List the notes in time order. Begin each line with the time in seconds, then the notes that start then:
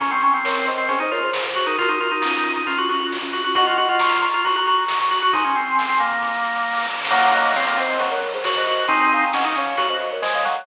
0.00 C#4 A#5 C#6, kick, closed hi-hat
0.11 C4 A#5 C#6, closed hi-hat
0.21 C#4 A#5 C#6, closed hi-hat
0.34 C4 A#5 C#6, closed hi-hat
0.44 A#4 C#5, snare
0.56 closed hi-hat
0.66 C5 D#5, closed hi-hat
0.78 C4, closed hi-hat
0.88 C#4 G#4 C5, kick, closed hi-hat
0.99 D#4 C5 D#5, closed hi-hat
1.11 F4 A#4 C#5, closed hi-hat
1.22 G#4 C5, closed hi-hat
1.33 snare
1.44 G#4 C5, kick, closed hi-hat
1.55 F#4, closed hi-hat
1.66 D#4 F#4 A#4, closed hi-hat
1.78 F4 F#4 A#4, kick, closed hi-hat
1.89 D#4 F#4 A#4, closed hi-hat
2.00 F4 F#4 A#4, closed hi-hat
2.11 D#4 F#4 A#4, closed hi-hat
2.22 C#4 F4, snare
2.34 closed hi-hat
2.44 C#4 F4, closed hi-hat
2.54 D#4, kick, closed hi-hat
2.66 C#4 F4, kick, closed hi-hat
2.78 C#4 F4 F#4, closed hi-hat
2.89 C#4 F4 F#4, closed hi-hat
3.00 C#4 F4, closed hi-hat
3.12 snare
3.22 C#4 F4, kick, closed hi-hat
3.33 F#4, closed hi-hat
3.44 C#4 F4 F#4, closed hi-hat
3.55 F#4 D#5 F#5, kick, closed hi-hat
3.66 F4 D#5 F#5, closed hi-hat
3.77 F#4 D#5 F#5, closed hi-hat
3.89 F4 D#5 F#5, closed hi-hat
3.99 A#5 C#6, snare
4.12 closed hi-hat
4.21 A#5 C#6, closed hi-hat
4.33 F4, closed hi-hat
4.44 F#4 A#5 C#6, kick, closed hi-hat
4.56 F#4 A#5 C#6, closed hi-hat
4.67 F#4 A#5 C#6, closed hi-hat
4.78 A#5 C#6, closed hi-hat
4.88 snare
5.00 A#5 C#6, kick, closed hi-hat
5.11 F#4, closed hi-hat
5.22 F#4 A#5 C#6, closed hi-hat
5.33 D#4 G#5 C6, kick, closed hi-hat
5.44 C#4, closed hi-hat
5.55 C4, closed hi-hat
5.66 closed hi-hat
5.79 snare
5.89 C4, closed hi-hat
6.00 A#3, closed hi-hat
6.11 kick, closed hi-hat
6.22 kick, snare
6.34 snare
6.44 snare
6.56 snare
6.67 snare
6.72 snare
6.77 snare
6.82 snare
6.89 snare
6.95 snare
7.00 snare
7.04 snare
7.10 F#3 A#3 F#5 A#5, kick, crash
7.22 closed hi-hat
7.33 D#5 F#5, closed hi-hat
7.45 closed hi-hat
7.54 C4 C#5 F5, snare
7.67 A#3, closed hi-hat
7.77 C4 C5 D#5, closed hi-hat
7.89 closed hi-hat
7.99 F#3, kick, closed hi-hat
8.11 A#4 C#5, closed hi-hat
8.22 closed hi-hat
8.34 G#4 C5, closed hi-hat
8.44 F#4 A#4 C#5, snare
8.55 C5 D#5, kick, closed hi-hat
8.67 F#4, closed hi-hat
8.79 closed hi-hat
8.88 C4 D#4 G#5 C6, kick, closed hi-hat
9.00 closed hi-hat
9.12 F5 G#5, closed hi-hat
9.23 closed hi-hat
9.33 C#4 D#5 F#5, snare
9.44 D#4, closed hi-hat
9.56 C#4 C#5 F5, closed hi-hat
9.65 kick, closed hi-hat
9.77 F#4, kick, closed hi-hat
9.89 C5 D#5, closed hi-hat
9.99 closed hi-hat
10.11 A#4 C#5, closed hi-hat
10.22 G#3 C5 D#5, snare
10.33 C#5 F5, kick, closed hi-hat
10.45 F#3, closed hi-hat
10.55 closed hi-hat